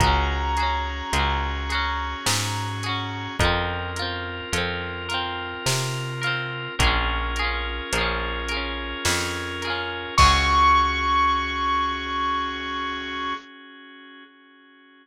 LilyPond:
<<
  \new Staff \with { instrumentName = "Acoustic Grand Piano" } { \time 3/4 \key des \major \tempo 4 = 53 bes''2. | r2. | r2. | des'''2. | }
  \new Staff \with { instrumentName = "Overdriven Guitar" } { \time 3/4 \key des \major <des' ges' aes'>8 <des' ges' aes'>8 <des' ges' aes'>8 <des' ges' aes'>4 <des' ges' aes'>8 | <c' f' bes'>8 <c' f' bes'>8 <c' f' bes'>8 <c' f' bes'>4 <c' f' bes'>8 | <des' f' aes' bes'>8 <des' f' aes' bes'>8 <des' f' aes' bes'>8 <des' f' aes' bes'>4 <des' f' aes' bes'>8 | <des' ges' aes'>2. | }
  \new Staff \with { instrumentName = "Drawbar Organ" } { \time 3/4 \key des \major <des' ges' aes'>2. | <c' f' bes'>2. | <des' f' aes' bes'>2. | <des' ges' aes'>2. | }
  \new Staff \with { instrumentName = "Electric Bass (finger)" } { \clef bass \time 3/4 \key des \major des,4 des,4 aes,4 | f,4 f,4 c4 | bes,,4 bes,,4 f,4 | des,2. | }
  \new DrumStaff \with { instrumentName = "Drums" } \drummode { \time 3/4 <hh bd>8 hh8 hh8 hh8 sn8 hh8 | <hh bd>8 hh8 hh8 hh8 sn8 hh8 | <hh bd>8 hh8 hh8 hh8 sn8 hh8 | <cymc bd>4 r4 r4 | }
>>